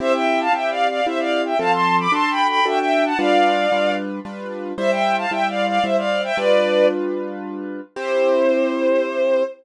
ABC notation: X:1
M:3/4
L:1/16
Q:1/4=113
K:C
V:1 name="Violin"
[ce] [eg]2 [fa] (3[eg]2 [df]2 [df]2 [ce] [df]2 [eg] | [fa] [ac']2 [bd'] (3[ac']2 [gb]2 [gb]2 [eg] [eg]2 [^fa] | [df]6 z6 | [ce] [eg]2 [fa] (3[eg]2 [df]2 [df]2 [ce] [df]2 [eg] |
[Bd]4 z8 | c12 |]
V:2 name="Acoustic Grand Piano"
[CEG]4 [CEG]4 [CEG]4 | [F,CA]4 [D^FA]4 [DFA]4 | [G,DFB]4 [G,DFB]4 [G,DFB]4 | [G,Ec]4 [G,Ec]4 [G,Ec]4 |
[G,DFB]12 | [CEG]12 |]